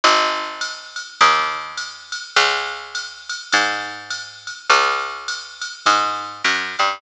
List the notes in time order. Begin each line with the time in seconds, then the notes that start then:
0.04 G#1, ride
0.61 ride
0.96 hi-hat pedal, ride
1.21 D#2, kick, ride
1.77 hi-hat pedal, ride
2.12 ride
2.36 C#2, ride
2.95 hi-hat pedal, ride
3.29 ride
3.52 G#2, kick, ride
4.10 hi-hat pedal, ride
4.47 ride
4.70 C#2, ride
5.28 hi-hat pedal, ride
5.62 ride
5.86 G#2, kick, ride
6.44 F#2, hi-hat pedal, ride
6.79 G2, ride